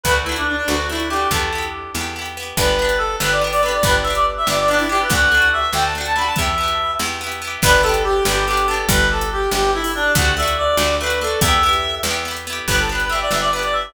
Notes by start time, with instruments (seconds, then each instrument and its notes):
0.04 electric bass (finger) D2, acoustic guitar (steel) A3, clarinet B4, kick, closed hi-hat
0.08 acoustic guitar (steel) D4 F#4
0.24 acoustic guitar (steel) A3, clarinet E4
0.29 acoustic guitar (steel) D4 F#4
0.36 clarinet D4, closed hi-hat
0.48 clarinet D4
0.57 clarinet D4
0.67 electric bass (finger) D2, acoustic guitar (steel) A3 D4, clarinet F#4, snare
0.74 acoustic guitar (steel) F#4
0.89 acoustic guitar (steel) A3 D4, clarinet E4
0.95 acoustic guitar (steel) F#4
1.00 closed hi-hat
1.10 acoustic guitar (steel) A3 D4, clarinet G4
1.16 acoustic guitar (steel) F#4
1.30 electric bass (finger) E2, acoustic guitar (steel) B3 E4, clarinet A4, kick, closed hi-hat
1.37 acoustic guitar (steel) G4
1.52 acoustic guitar (steel) B3 E4
1.58 acoustic guitar (steel) G4
1.62 closed hi-hat
1.94 electric bass (finger) E2, acoustic guitar (steel) B3 E4, snare
2.01 acoustic guitar (steel) G4
2.16 acoustic guitar (steel) B3 E4
2.22 acoustic guitar (steel) G4, closed hi-hat
2.37 acoustic guitar (steel) B3 E4
2.43 acoustic guitar (steel) G4
2.57 electric bass (finger) G1, acoustic guitar (steel) B3 D4, clarinet B4, kick, closed hi-hat
2.64 acoustic guitar (steel) G4
2.79 acoustic guitar (steel) B3 D4
2.85 acoustic guitar (steel) G4
2.89 closed hi-hat
2.98 clarinet A4
3.20 electric bass (finger) G1, acoustic guitar (steel) B3 D4, clarinet B4, snare
3.26 acoustic guitar (steel) G4
3.32 clarinet D5
3.41 acoustic guitar (steel) B3 D4
3.47 acoustic guitar (steel) G4
3.51 clarinet D5, open hi-hat
3.62 acoustic guitar (steel) B3, clarinet B4
3.66 acoustic guitar (steel) D4 G4
3.73 clarinet D5
3.83 electric bass (finger) G1, acoustic guitar (steel) B3 D4, clarinet B4, kick, closed hi-hat
3.90 acoustic guitar (steel) G4
4.03 acoustic guitar (steel) B3, clarinet E5
4.07 acoustic guitar (steel) D4 G4
4.15 clarinet D5, closed hi-hat
4.37 clarinet E5
4.47 electric bass (finger) G1, acoustic guitar (steel) B3 D4, clarinet D5, snare
4.53 acoustic guitar (steel) G4
4.59 clarinet D5
4.68 acoustic guitar (steel) B3 D4, clarinet D4
4.74 acoustic guitar (steel) G4
4.78 clarinet E4, open hi-hat
4.89 acoustic guitar (steel) B3 D4, clarinet G4
4.95 acoustic guitar (steel) G4
5.00 clarinet B4
5.09 electric bass (finger) D2, acoustic guitar (steel) A3 D4, clarinet F#5, kick, closed hi-hat
5.15 acoustic guitar (steel) F#4
5.32 acoustic guitar (steel) A3 D4
5.37 acoustic guitar (steel) F#4
5.42 closed hi-hat
5.52 clarinet E5
5.73 electric bass (finger) D2, acoustic guitar (steel) A3 D4, clarinet G5, snare
5.79 acoustic guitar (steel) F#4
5.84 clarinet A5
5.95 acoustic guitar (steel) A3 D4
6.01 acoustic guitar (steel) F#4
6.06 clarinet A5, closed hi-hat
6.16 acoustic guitar (steel) A3 D4, clarinet B5
6.21 acoustic guitar (steel) F#4
6.26 clarinet A5
6.36 electric bass (finger) E2, acoustic guitar (steel) B3 E4, clarinet E5, kick, closed hi-hat
6.42 acoustic guitar (steel) G4
6.58 acoustic guitar (steel) B3 E4
6.64 acoustic guitar (steel) G4
6.68 closed hi-hat
6.99 electric bass (finger) E2, acoustic guitar (steel) B3 E4, snare
7.05 acoustic guitar (steel) G4
7.21 acoustic guitar (steel) B3 E4
7.27 acoustic guitar (steel) G4
7.32 closed hi-hat
7.42 acoustic guitar (steel) B3 E4
7.47 acoustic guitar (steel) G4
7.62 electric bass (finger) G1, acoustic guitar (steel) B3 D4, clarinet B4, kick, crash
7.68 acoustic guitar (steel) G4
7.82 acoustic guitar (steel) B3 D4, clarinet A4
7.89 acoustic guitar (steel) G4
7.94 closed hi-hat
8.04 clarinet G4
8.25 electric bass (finger) G1, acoustic guitar (steel) B3 D4, clarinet G4, snare
8.32 acoustic guitar (steel) G4
8.47 acoustic guitar (steel) B3 D4, clarinet G4
8.53 acoustic guitar (steel) G4, closed hi-hat
8.66 acoustic guitar (steel) B3, clarinet A4
8.71 acoustic guitar (steel) D4 G4
8.89 electric bass (finger) G1, clarinet B4, kick, closed hi-hat
9.11 clarinet A4
9.21 closed hi-hat
9.32 clarinet G4
9.51 electric bass (finger) G1, clarinet G4, snare
9.74 clarinet E4
9.84 open hi-hat
9.94 clarinet D4
10.15 electric bass (finger) D2, acoustic guitar (steel) A3 D4, clarinet F#5, kick, closed hi-hat
10.22 acoustic guitar (steel) F#4
10.37 acoustic guitar (steel) A3 D4, clarinet E5
10.42 acoustic guitar (steel) F#4
10.48 closed hi-hat
10.58 clarinet D5
10.77 electric bass (finger) D2, acoustic guitar (steel) A3 D4, clarinet D5, snare
10.84 acoustic guitar (steel) F#4
11.00 acoustic guitar (steel) A3 D4, clarinet B4
11.06 acoustic guitar (steel) F#4, closed hi-hat
11.21 acoustic guitar (steel) A3 D4, clarinet A4
11.27 acoustic guitar (steel) F#4
11.40 electric bass (finger) E2, acoustic guitar (steel) B3, clarinet E5, kick, closed hi-hat
11.45 acoustic guitar (steel) E4 G4
11.63 acoustic guitar (steel) B3 E4
11.69 acoustic guitar (steel) G4
11.73 closed hi-hat
12.03 electric bass (finger) E2, acoustic guitar (steel) B3, snare
12.08 acoustic guitar (steel) E4 G4
12.25 acoustic guitar (steel) B3 E4
12.31 acoustic guitar (steel) G4
12.37 closed hi-hat
12.47 acoustic guitar (steel) B3 E4
12.53 acoustic guitar (steel) G4
12.67 electric bass (finger) G1, acoustic guitar (steel) B3, clarinet B4, kick, crash
12.72 acoustic guitar (steel) D4 G4
12.79 clarinet A4
12.89 acoustic guitar (steel) B3 D4, clarinet B4
12.95 acoustic guitar (steel) G4
13.00 clarinet B4, closed hi-hat
13.09 acoustic guitar (steel) B3 D4, clarinet E5
13.15 acoustic guitar (steel) G4
13.21 clarinet D5
13.31 electric bass (finger) G1, acoustic guitar (steel) B3 D4, clarinet E5, snare
13.37 acoustic guitar (steel) G4, clarinet D5
13.52 acoustic guitar (steel) B3, clarinet B4
13.56 acoustic guitar (steel) D4 G4
13.63 clarinet D5, closed hi-hat
13.73 clarinet E5